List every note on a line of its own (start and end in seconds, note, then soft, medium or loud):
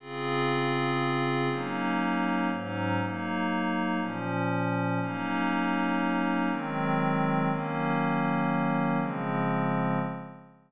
0.00 1.49 C#3 medium
0.00 1.49 C4 medium
0.00 1.49 F4 medium
0.00 1.49 G#4 medium
1.50 2.49 F#3 medium
1.50 2.49 A#3 medium
1.50 2.49 C#4 medium
1.50 2.49 D#4 medium
2.50 2.99 G#2 loud
2.50 2.99 F#3 medium
2.50 2.99 C#4 medium
2.50 2.99 D#4 medium
3.01 3.99 F#3 medium
3.01 3.99 A#3 medium
3.01 3.99 D#4 medium
4.00 4.99 A#2 medium
4.00 4.99 F3 medium
4.00 4.99 C#4 medium
5.01 6.49 F#3 medium
5.01 6.49 A#3 medium
5.01 6.49 C#4 medium
5.01 6.49 D#4 medium
6.50 7.49 D#3 loud
6.50 7.49 F#3 medium
6.50 7.49 G#3 medium
6.50 7.49 C4 loud
7.50 8.99 D#3 medium
7.50 8.99 F#3 medium
7.50 8.99 A#3 loud
7.50 8.99 C#4 medium
8.99 9.98 C#3 medium
8.99 9.98 F3 medium
8.99 9.98 G#3 medium
8.99 9.98 C4 medium